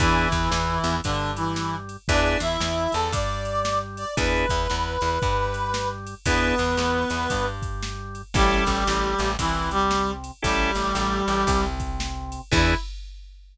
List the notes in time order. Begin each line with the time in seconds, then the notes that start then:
0.00 E2 E3 B3 D4 E4 G#4, kick, ride
0.31 E2 E3, kick, ride
0.52 E2 E3, snare
0.84 E2 E3, ride
1.04 G2 D3 G3 D4, kick, ride
1.36 E3 E4, ride
1.56 snare
1.89 ride
2.08 E2 B3 D4 E4 G#4 D5, kick, ride
2.40 E2 E3 E4 E5, ride
2.60 E2 E3, snare
2.92 E2 E3 A4 A5, ride
3.12 G2 G3 D5 D6, kick, ride
3.45 ride
3.65 snare
3.97 D5 D6, ride
4.17 E2 B3 D4 E4 G#4 B4 B5, kick, ride
4.49 E2 E3, kick, ride
4.70 E2 E3, snare
5.01 E2 E3, ride
5.22 G2 G3, kick, ride
5.54 ride
5.74 snare
6.07 ride
6.26 E2 B3 D4 E4 G#4 B4, kick, ride
6.58 E2 E3, ride
6.77 E2 E3, snare
7.10 E2 E3, ride
7.29 G2 G3, kick, ride
7.62 kick, ride
7.82 snare
8.15 ride
8.34 A1 G3 C#4 E4 G4 A4, kick, ride
8.66 A1 A3, kick, ride
8.87 A1 A3, snare
9.18 A1 A3, ride
9.39 C2 C3 E3 E4, kick, ride
9.71 G3 G4, ride
9.91 snare
10.24 ride
10.42 A1 G3 C#4 E4 G4 A4, kick, ride
10.75 A1 A3, ride
10.95 A1 A3, snare
11.28 A1 A3, ride
11.47 C2 C3, kick, ride
11.80 kick, ride
12.00 snare
12.32 ride
12.52 E2 B3 D4 E4 G#4, kick, crash